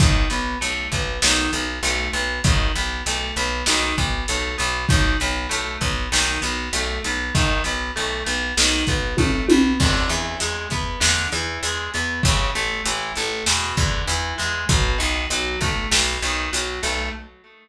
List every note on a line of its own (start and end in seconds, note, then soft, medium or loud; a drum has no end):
0.00 0.26 B1 loud
0.00 0.28 D#3 medium
0.00 kick loud
0.00 closed hi-hat medium
0.30 0.56 B1 medium
0.30 0.58 B3 medium
0.30 closed hi-hat medium
0.61 0.88 B1 medium
0.61 0.89 A3 medium
0.61 closed hi-hat medium
0.92 1.18 B1 medium
0.92 1.21 B3 medium
0.92 kick medium
0.92 closed hi-hat medium
1.22 1.49 B1 loud
1.22 1.51 D#3 medium
1.22 snare loud
1.53 1.79 B1 loud
1.53 1.80 B3 medium
1.53 closed hi-hat medium
1.83 2.09 B1 loud
1.83 2.11 A3 medium
1.83 closed hi-hat medium
2.13 2.39 B1 loud
2.13 2.41 B3 medium
2.13 closed hi-hat medium
2.44 2.70 B1 loud
2.44 2.72 D#3 medium
2.44 kick medium
2.44 closed hi-hat medium
2.76 3.02 B1 medium
2.76 3.03 B3 medium
2.76 closed hi-hat medium
3.06 3.32 B1 medium
3.06 3.35 A3 medium
3.06 closed hi-hat medium
3.36 3.63 B1 loud
3.36 3.65 B3 medium
3.36 closed hi-hat medium
3.66 3.93 B1 loud
3.66 3.95 D#3 medium
3.66 snare medium
3.98 4.24 B1 loud
3.98 4.25 B3 medium
3.98 kick medium
3.98 closed hi-hat medium
4.28 4.55 B1 loud
4.28 4.56 A3 medium
4.28 closed hi-hat medium
4.58 4.86 B1 loud
4.58 4.85 B3 medium
4.58 closed hi-hat medium
4.89 5.16 B1 loud
4.89 5.17 D#3 medium
4.89 kick medium
4.89 closed hi-hat medium
5.20 5.47 B1 loud
5.20 5.48 B3 medium
5.20 closed hi-hat medium
5.49 5.77 B1 medium
5.49 5.77 A3 medium
5.49 closed hi-hat medium
5.81 6.07 B1 loud
5.81 6.09 B3 medium
5.81 kick medium
5.81 closed hi-hat medium
6.12 6.38 B1 loud
6.12 6.40 D#3 medium
6.12 snare medium
6.41 6.69 B1 loud
6.41 6.69 B3 medium
6.41 closed hi-hat medium
6.73 6.99 B1 loud
6.73 7.02 A3 medium
6.73 closed hi-hat medium
7.04 7.30 B1 loud
7.04 7.33 B3 medium
7.04 closed hi-hat medium
7.35 7.61 B1 loud
7.35 7.62 D#3 loud
7.35 kick medium
7.35 closed hi-hat medium
7.64 7.91 B1 medium
7.64 7.92 B3 medium
7.64 closed hi-hat medium
7.96 8.23 B1 loud
7.96 8.23 A3 medium
8.26 8.52 B1 loud
8.26 8.54 B3 medium
8.26 closed hi-hat medium
8.57 8.83 B1 loud
8.57 8.85 D#3 medium
8.57 snare loud
8.87 9.14 B1 medium
8.87 9.16 B3 medium
8.87 kick medium
8.87 closed hi-hat medium
9.17 9.44 B1 medium
9.17 9.46 A3 medium
9.17 kick medium
9.17 high tom medium
9.49 9.76 B1 loud
9.49 9.78 B3 medium
9.49 high tom loud
9.80 10.06 E2 loud
9.80 10.09 D3 medium
9.80 kick medium
9.80 crash medium
10.09 10.35 E2 loud
10.09 10.38 E3 medium
10.09 closed hi-hat medium
10.40 10.67 E2 medium
10.40 10.68 G#3 medium
10.40 closed hi-hat medium
10.70 10.97 E2 medium
10.70 11.00 B3 medium
10.70 kick medium
10.70 closed hi-hat medium
11.00 11.27 E2 loud
11.00 11.28 D3 medium
11.00 snare medium
11.32 11.58 E2 loud
11.32 11.61 E3 medium
11.32 closed hi-hat medium
11.63 11.89 E2 loud
11.63 11.90 G#3 medium
11.63 closed hi-hat medium
11.94 12.21 E2 medium
11.94 12.22 B3 medium
11.94 closed hi-hat medium
12.23 12.51 A1 loud
12.23 12.51 C#3 medium
12.23 kick medium
12.23 closed hi-hat loud
12.55 12.81 A1 medium
12.55 12.83 A3 medium
12.55 closed hi-hat medium
12.85 13.12 A1 loud
12.85 13.13 E3 medium
12.85 closed hi-hat loud
13.15 13.43 A1 loud
13.15 13.45 A3 medium
13.15 closed hi-hat medium
13.46 13.73 E2 loud
13.46 13.75 B2 medium
13.46 snare medium
13.77 14.03 E2 loud
13.77 14.05 D3 medium
13.77 kick medium
13.77 closed hi-hat medium
14.08 14.34 E2 loud
14.08 14.35 E3 medium
14.08 closed hi-hat medium
14.38 14.65 E2 loud
14.38 14.65 G#3 medium
14.38 closed hi-hat medium
14.69 14.95 B1 loud
14.69 14.98 B2 medium
14.69 kick medium
14.69 closed hi-hat medium
14.98 15.26 B1 loud
14.98 15.26 D#3 medium
14.98 closed hi-hat medium
15.30 15.56 B1 medium
15.30 15.59 F#3 medium
15.30 closed hi-hat medium
15.61 15.87 B1 medium
15.61 15.89 A3 medium
15.61 kick medium
15.61 closed hi-hat medium
15.91 16.17 B1 loud
15.91 16.19 B2 medium
15.91 snare medium
16.22 16.48 B1 loud
16.22 16.50 D#3 medium
16.22 closed hi-hat medium
16.53 16.79 B1 medium
16.53 16.80 F#3 medium
16.53 closed hi-hat loud
16.83 17.09 B1 loud
16.83 17.10 A3 medium
16.83 closed hi-hat medium